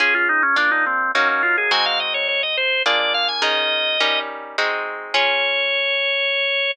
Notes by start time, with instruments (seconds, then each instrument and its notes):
0.00 acoustic guitar (steel) C#4 F4 G#4, drawbar organ G#4
0.15 drawbar organ F4
0.29 drawbar organ D#4
0.43 drawbar organ C#4
0.56 acoustic guitar (steel) A#3 D4 F4, drawbar organ D4
0.71 drawbar organ D#4
0.86 drawbar organ C4
1.15 acoustic guitar (steel) F#3 A#3 D#4, drawbar organ C#4
1.29 drawbar organ C#4
1.43 drawbar organ F4
1.58 drawbar organ G#4
1.71 acoustic guitar (steel) G#3 C4 D#4 F#4, drawbar organ G#5
1.86 drawbar organ F5
2.00 drawbar organ D#5
2.14 drawbar organ C#5
2.28 drawbar organ C#5
2.43 drawbar organ D#5
2.57 drawbar organ C5
2.86 acoustic guitar (steel) A#3 D4 F4 G#4, drawbar organ D5
3.00 drawbar organ D5
3.14 drawbar organ F5
3.28 drawbar organ G#5
3.42 acoustic guitar (steel) D#3 C#4 G#4 A#4, drawbar organ D#5
4.00 acoustic guitar (steel) G3 C#4 D#4 A#4
4.58 acoustic guitar (steel) G#3 C4 D#4 F#4
5.14 acoustic guitar (steel) C#4 F4 G#4, drawbar organ C#5